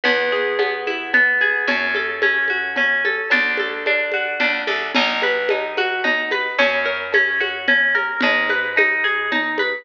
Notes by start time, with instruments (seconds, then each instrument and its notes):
0.04 electric bass (finger) E2, orchestral harp B3, cowbell, low conga
0.32 orchestral harp G#4
0.58 orchestral harp B3, cowbell, high conga
0.87 orchestral harp E4, high conga
1.13 orchestral harp B3, cowbell, low conga
1.41 orchestral harp G#4, high conga
1.68 electric bass (finger) F#2, orchestral harp C#4, cowbell, low conga
1.95 orchestral harp A4, high conga
2.22 orchestral harp C#4, cowbell, high conga
2.48 orchestral harp F#4, high conga
2.76 orchestral harp C#4, cowbell, low conga
3.05 orchestral harp A4, high conga
3.30 electric bass (finger) D2, orchestral harp D4, cowbell, low conga
3.57 orchestral harp A4, high conga
3.86 orchestral harp D4, cowbell, high conga
4.12 orchestral harp F#4, high conga
4.40 electric bass (finger) C#2, orchestral harp D4, cowbell, low conga
4.67 electric bass (finger) C2, orchestral harp A4, high conga
4.95 electric bass (finger) B1, orchestral harp D#4, crash, cowbell, low conga
5.22 orchestral harp B4, high conga
5.49 orchestral harp D#4, cowbell, high conga
5.77 orchestral harp F#4, high conga
6.04 orchestral harp D#4, cowbell, low conga
6.31 orchestral harp B4, high conga
6.58 electric bass (finger) F#2, orchestral harp C#4, cowbell, low conga
6.85 orchestral harp A#4
7.12 orchestral harp C#4, cowbell, high conga
7.40 orchestral harp F#4, high conga
7.68 orchestral harp C#4, cowbell, low conga
7.94 orchestral harp A#4, high conga
8.21 electric bass (finger) G#2, orchestral harp D#4, cowbell, low conga
8.49 orchestral harp B4, high conga
8.76 orchestral harp D#4, cowbell, high conga
9.04 orchestral harp G#4, high conga
9.31 orchestral harp D#4, cowbell, low conga
9.58 orchestral harp B4, high conga